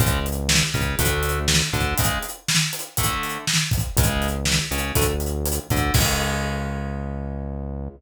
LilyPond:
<<
  \new Staff \with { instrumentName = "Overdriven Guitar" } { \time 4/4 \key cis \phrygian \tempo 4 = 121 <cis gis>8 r4 cis8 <d a>4. d8 | <cis gis>8 r4. <d a>4. r8 | <cis gis>8. r8. cis8 <d a>16 r4 r16 d8 | <cis gis>1 | }
  \new Staff \with { instrumentName = "Synth Bass 1" } { \clef bass \time 4/4 \key cis \phrygian cis,4. cis,8 d,4. d,8 | r1 | cis,4. cis,8 d,4. d,8 | cis,1 | }
  \new DrumStaff \with { instrumentName = "Drums" } \drummode { \time 4/4 <hh bd>8 hh8 sn8 <hh bd>8 <hh bd>8 hh8 sn8 <hh bd>8 | <hh bd>8 hh8 sn8 hh8 <hh bd>8 hh8 sn8 <hh bd>8 | <hh bd>8 hh8 sn8 hh8 <hh bd>8 hh8 hh8 <hh bd>8 | <cymc bd>4 r4 r4 r4 | }
>>